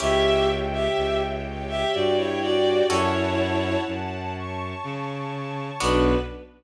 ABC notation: X:1
M:3/4
L:1/16
Q:1/4=62
K:Bm
V:1 name="Violin"
[Ge]2 z [Ge]2 z2 [Ge] [Fd] [Ec] [Fd]2 | [Ec]4 z8 | B4 z8 |]
V:2 name="Orchestral Harp"
[CEG]12 | [CFA]12 | [B,DF]4 z8 |]
V:3 name="String Ensemble 1"
[ceg]6 [Gcg]6 | [cfa]6 [cac']6 | [B,DF]4 z8 |]
V:4 name="Violin" clef=bass
C,,4 C,,4 G,,4 | F,,4 F,,4 C,4 | B,,,4 z8 |]